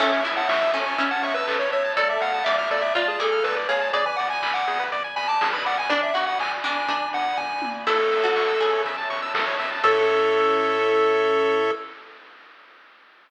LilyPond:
<<
  \new Staff \with { instrumentName = "Lead 1 (square)" } { \time 4/4 \key a \major \tempo 4 = 122 e''16 e''16 r16 fis''16 e''8 gis''8. fis''16 e''16 b'8 cis''16 cis''8 | d''16 e''16 fis''8 e''16 e''16 d''16 e''16 d''16 gis'16 a'8 b'16 r16 cis''8 | d''16 gis''16 fis''16 gis''8 fis''8. r8 gis''16 a''8 b''16 fis''16 gis''16 | d''16 e''16 fis''16 fis''16 gis''16 r16 gis''4 fis''8 gis''8. r16 |
a'2 r2 | a'1 | }
  \new Staff \with { instrumentName = "Pizzicato Strings" } { \time 4/4 \key a \major cis'8 e'4 cis'8 cis'2 | a'4 d''4 f'8 gis'4 gis'8 | d''2. r4 | d'8 fis'4 d'8 d'2 |
e'16 r8 fis'8. gis'4. r4 | a'1 | }
  \new Staff \with { instrumentName = "Lead 1 (square)" } { \time 4/4 \key a \major a'16 cis''16 e''16 a''16 cis'''16 e'''16 a'16 cis''16 e''16 a''16 cis'''16 e'''16 a'16 cis''16 e''16 a''16 | a'16 d''16 f''16 a''16 d'''16 f'''16 a'16 d''16 f''16 a''16 d'''16 f'''16 a'16 d''16 f''16 a''16 | gis'16 b'16 d''16 gis''16 b''16 d'''16 gis'16 b'16 d''16 gis''16 b''16 d'''16 gis'16 b'16 d''16 gis''16 | r1 |
a'16 cis''16 e''16 a''16 cis'''16 e'''16 a'16 cis''16 e''16 a''16 cis'''16 e'''16 a'16 cis''16 e''16 a''16 | <a' cis'' e''>1 | }
  \new Staff \with { instrumentName = "Synth Bass 1" } { \clef bass \time 4/4 \key a \major a,,8 a,,8 a,,8 a,,8 a,,8 a,,8 a,,8 a,,8 | d,8 d,8 d,8 d,8 d,8 d,8 d,8 d,8 | gis,,8 gis,,8 gis,,8 gis,,8 gis,,8 gis,,8 gis,,8 gis,,8~ | gis,,8 gis,,8 gis,,8 gis,,8 gis,,8 gis,,8 g,,8 gis,,8 |
a,,8 a,,8 a,,8 a,,8 a,,8 a,,8 a,,8 a,,8 | a,1 | }
  \new Staff \with { instrumentName = "String Ensemble 1" } { \time 4/4 \key a \major <cis'' e'' a''>1 | <d'' f'' a''>1 | <d'' gis'' b''>1 | <d'' gis'' b''>1 |
<cis'' e'' a''>1 | <cis' e' a'>1 | }
  \new DrumStaff \with { instrumentName = "Drums" } \drummode { \time 4/4 <cymc bd>8 hho8 <bd sn>8 hho8 <hh bd>8 hho8 <hc bd>8 hho8 | <hh bd>8 hho8 <bd sn>8 hho8 <hh bd>8 hho8 <bd sn>8 hho8 | <hh bd>8 hho8 <hc bd>8 hho8 <hh bd>8 hho8 <bd sn>8 hho8 | <hh bd>8 hho8 <hc bd>8 hho8 <hh bd>8 hho8 <bd tomfh>8 tommh8 |
<cymc bd>8 hho8 <hc bd>8 hho8 <hh bd>8 hho8 <bd sn>8 hho8 | <cymc bd>4 r4 r4 r4 | }
>>